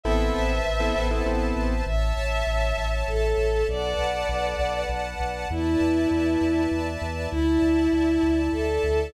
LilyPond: <<
  \new Staff \with { instrumentName = "Violin" } { \time 3/4 \key a \minor \tempo 4 = 99 e''2 r4 | \key a \major e''2 a'4 | d''2 r4 | e'2 r4 |
e'2 a'4 | }
  \new Staff \with { instrumentName = "Acoustic Grand Piano" } { \time 3/4 \key a \minor <b c' e' a'>4~ <b c' e' a'>16 <b c' e' a'>16 <b c' e' a'>16 <b c' e' a'>16 <b c' e' a'>4 | \key a \major r2. | r2. | r2. |
r2. | }
  \new Staff \with { instrumentName = "Synth Bass 2" } { \clef bass \time 3/4 \key a \minor a,,8 a,,8 a,,8 a,,8 a,,8 a,,8 | \key a \major a,,8 a,,8 a,,8 a,,8 a,,8 a,,8 | b,,8 b,,8 b,,8 b,,8 b,,8 b,,8 | e,8 e,8 e,8 e,8 e,8 e,8 |
d,8 d,8 d,8 d,8 d,8 d,8 | }
  \new Staff \with { instrumentName = "String Ensemble 1" } { \time 3/4 \key a \minor <b' c'' e'' a''>2. | \key a \major <cis'' e'' a''>2. | <b' d'' fis'' a''>2. | <b' d'' e'' a''>2. |
<d'' e'' a''>2. | }
>>